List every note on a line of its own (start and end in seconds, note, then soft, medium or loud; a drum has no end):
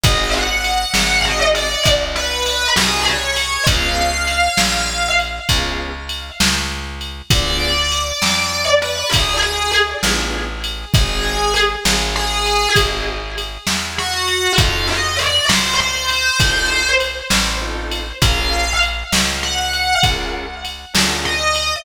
0.04 0.85 G#1 medium
0.04 0.47 C4 medium
0.04 0.47 D#4 loud
0.04 0.47 F#4 medium
0.04 0.47 G#4 medium
0.04 0.30 D#5 loud
0.04 kick loud
0.04 ride loud
0.34 1.21 F#5 medium
0.64 ride medium
0.94 1.76 G#1 medium
0.94 snare loud
1.25 1.67 C4 medium
1.25 1.67 D#4 medium
1.25 1.67 F#4 medium
1.25 1.67 G#4 medium
1.25 1.40 D#5 medium
1.55 1.83 D5 medium
1.55 ride medium
1.85 2.67 C2 medium
1.85 kick medium
1.85 ride loud
2.16 2.68 B4 medium
2.46 ride medium
2.75 3.58 C2 medium
2.75 3.18 C4 medium
2.75 3.18 D#4 medium
2.75 3.18 F#4 medium
2.75 3.18 G#4 medium
2.75 3.03 G#4 medium
2.75 snare loud
3.08 3.64 C#5 medium
3.36 ride medium
3.67 4.49 C#2 loud
3.67 4.10 B3 medium
3.67 4.10 C#4 loud
3.67 4.10 F4 medium
3.67 4.10 G#4 medium
3.67 5.08 F5 medium
3.67 kick loud
3.67 ride loud
4.27 ride medium
4.57 5.40 A#1 medium
4.57 snare loud
5.19 ride medium
5.49 6.31 C#2 medium
5.49 5.92 B3 medium
5.49 5.92 C#4 medium
5.49 5.92 F4 medium
5.49 5.92 G#4 medium
5.49 kick medium
5.49 ride loud
6.09 ride medium
6.40 7.22 C#2 medium
6.40 snare loud
7.01 ride medium
7.30 8.12 D2 medium
7.30 7.73 B3 medium
7.30 7.73 D4 medium
7.30 7.73 F4 medium
7.30 7.73 G#4 medium
7.30 8.64 D5 loud
7.30 kick loud
7.30 ride loud
7.92 ride medium
8.22 9.04 F2 medium
8.22 snare loud
8.82 9.09 B4 medium
8.82 ride medium
9.11 9.94 D2 medium
9.11 9.36 G#4 medium
9.11 kick medium
9.11 ride loud
9.42 9.71 G#4 medium
9.73 ride medium
10.03 10.85 A1 medium
10.03 10.47 B3 medium
10.03 10.47 D4 medium
10.03 10.47 F4 medium
10.03 10.47 G#4 medium
10.03 snare loud
10.64 ride medium
10.94 11.76 G#1 medium
10.94 11.37 C4 medium
10.94 11.37 D#4 medium
10.94 11.37 F#4 medium
10.94 11.37 G#4 medium
10.94 11.54 G#4 loud
10.94 kick loud
10.94 ride loud
11.56 ride medium
11.85 12.67 G#1 medium
11.85 snare loud
12.16 12.69 G#4 medium
12.46 ride medium
12.76 13.58 G#1 medium
12.76 13.18 C4 medium
12.76 13.18 D#4 medium
12.76 13.18 F#4 medium
12.76 13.18 G#4 medium
12.76 kick medium
12.76 ride loud
13.38 ride medium
13.67 14.49 E2 medium
13.67 snare loud
13.98 14.53 F#4 medium
14.28 ride medium
14.58 15.40 F2 medium
14.58 15.00 C4 medium
14.58 15.00 D#4 medium
14.58 15.00 F4 medium
14.58 15.00 A4 medium
14.58 14.87 F5 loud
14.58 kick loud
14.58 ride loud
14.89 15.16 D#5 medium
15.19 15.45 D5 medium
15.19 ride medium
15.49 16.31 C#2 medium
15.49 15.73 C5 medium
15.49 snare loud
15.80 16.89 C5 medium
16.09 ride medium
16.39 17.22 C2 medium
16.39 16.82 C4 medium
16.39 16.82 D#4 medium
16.39 16.82 F4 medium
16.39 16.82 A4 medium
16.39 kick loud
16.39 ride loud
17.00 ride medium
17.30 18.13 A1 medium
17.30 snare loud
17.61 18.03 C4 medium
17.61 18.03 D#4 medium
17.61 18.03 F4 medium
17.61 18.03 A4 medium
17.91 ride medium
18.21 19.04 A#1 medium
18.21 18.64 C#4 medium
18.21 18.64 F4 medium
18.21 18.64 G#4 medium
18.21 18.64 A#4 medium
18.21 18.73 F5 loud
18.21 kick loud
18.21 ride loud
18.82 ride medium
19.12 19.94 C#2 medium
19.12 snare loud
19.43 19.95 F#5 medium
19.73 ride medium
20.03 20.85 C#2 medium
20.03 20.46 C#4 medium
20.03 20.46 F4 medium
20.03 20.46 G#4 medium
20.03 20.46 A#4 medium
20.03 kick loud
20.03 ride loud
20.65 ride medium
20.93 21.76 D2 medium
20.93 21.36 C#4 medium
20.93 21.36 F4 medium
20.93 21.36 G#4 medium
20.93 21.36 A#4 medium
20.93 snare loud
21.25 21.76 D#5 loud
21.55 ride medium